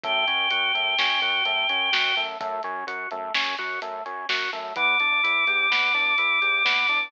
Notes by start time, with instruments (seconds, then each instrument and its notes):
0.03 synth bass 1 F#2, drawbar organ A3, choir aahs G5, kick, closed hi-hat
0.27 synth bass 1 F#2, drawbar organ C#4, closed hi-hat
0.50 synth bass 1 F#2, drawbar organ F#4, closed hi-hat
0.75 synth bass 1 F#2, drawbar organ A3, closed hi-hat
0.98 synth bass 1 F#2, drawbar organ C#4, snare
1.22 synth bass 1 F#2, drawbar organ F#4, closed hi-hat
1.45 synth bass 1 F#2, drawbar organ A3, closed hi-hat
1.69 synth bass 1 F#2, drawbar organ C#4, closed hi-hat
1.92 synth bass 1 F#2, drawbar organ F#4, snare
2.17 synth bass 1 F#2, drawbar organ A3, closed hi-hat
2.40 synth bass 1 F#2, drawbar organ A3, kick, closed hi-hat
2.63 synth bass 1 F#2, drawbar organ C#4, closed hi-hat
2.87 synth bass 1 F#2, drawbar organ F#4, closed hi-hat
3.11 synth bass 1 F#2, drawbar organ A3, closed hi-hat
3.34 synth bass 1 F#2, drawbar organ C#4, snare
3.58 synth bass 1 F#2, drawbar organ F#4, closed hi-hat
3.81 synth bass 1 F#2, drawbar organ A3, closed hi-hat
4.05 synth bass 1 F#2, drawbar organ C#4, closed hi-hat
4.29 synth bass 1 F#2, drawbar organ F#4, snare
4.53 synth bass 1 F#2, drawbar organ A3, closed hi-hat
4.76 synth bass 1 E2, drawbar organ B3, choir aahs D6, kick, closed hi-hat
5.00 synth bass 1 E2, drawbar organ D4, closed hi-hat
5.23 synth bass 1 E2, drawbar organ E4, closed hi-hat
5.47 synth bass 1 E2, drawbar organ G4, closed hi-hat
5.70 synth bass 1 E2, drawbar organ B3, snare
5.94 synth bass 1 E2, drawbar organ D4, closed hi-hat
6.18 synth bass 1 E2, drawbar organ E4, closed hi-hat
6.42 synth bass 1 E2, drawbar organ G4, closed hi-hat
6.65 synth bass 1 E2, drawbar organ B3, snare
6.88 synth bass 1 E2, drawbar organ D4, closed hi-hat